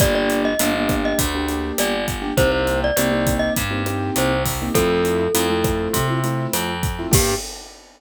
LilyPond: <<
  \new Staff \with { instrumentName = "Glockenspiel" } { \time 4/4 \key g \minor \tempo 4 = 101 d''16 d''8 ees''4 ees''16 r4 d''8 r8 | c''16 c''8 d''4 ees''16 r4 c''8 r8 | a'2~ a'8 r4. | g'4 r2. | }
  \new Staff \with { instrumentName = "Acoustic Grand Piano" } { \time 4/4 \key g \minor <bes d' g'>4 <bes d' g'>16 <bes d' g'>4 <bes d' g'>16 <bes d' g'>4~ <bes d' g'>16 <bes d' g'>16 | <bes c' ees' g'>4 <bes c' ees' g'>16 <bes c' ees' g'>4 <bes c' ees' g'>16 <bes c' ees' g'>4~ <bes c' ees' g'>16 <bes c' ees' g'>16 | <a c' e' f'>4 <a c' e' f'>16 <a c' e' f'>4 <a c' e' f'>16 <a c' e' f'>4~ <a c' e' f'>16 <a c' e' f'>16 | <bes d' g'>4 r2. | }
  \new Staff \with { instrumentName = "Electric Bass (finger)" } { \clef bass \time 4/4 \key g \minor g,,4 g,,4 d,4 g,,4 | c,4 c,4 g,4 c,4 | f,4 f,4 c4 f,4 | g,4 r2. | }
  \new DrumStaff \with { instrumentName = "Drums" } \drummode { \time 4/4 <hh bd ss>8 hh8 hh8 <hh bd ss>8 <hh bd>8 hh8 <hh ss>8 <hh bd>8 | <hh bd>8 hh8 <hh ss>8 <hh bd>8 <hh bd>8 <hh ss>8 hh8 <hho bd>8 | <hh bd ss>8 hh8 hh8 <hh bd ss>8 <hh bd>8 hh8 <hh ss>8 <hh bd>8 | <cymc bd>4 r4 r4 r4 | }
>>